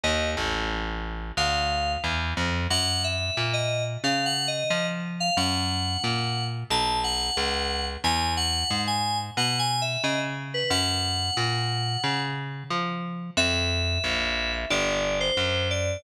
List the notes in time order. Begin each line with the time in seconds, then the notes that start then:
0.03 D#2 D#5
0.37 A1
1.37 D2 F5
2.04 E2
2.37 F2
2.70 F#2 F#5
3.04 E5
3.37 A#2
3.53 D#5
4.04 C#3 F5
4.26 F#5
4.48 D#5
4.70 F3 D#5
5.20 F5
5.37 F#2 F#5
6.04 A#2
6.70 B1 A5
7.04 F#5
7.37 C#2
8.04 E2 G#5
8.37 F#5
8.71 G#2
8.87 G#5
9.37 B2 F#5
9.59 G#5
9.82 E5
10.04 C#3 D#5
10.54 B4
10.70 F#2 F#5
11.37 A#2
12.04 C#3
12.70 F3
13.37 F2 E5
14.04 A#1
14.70 G1 D5
15.20 C5
15.37 F#2
15.70 D5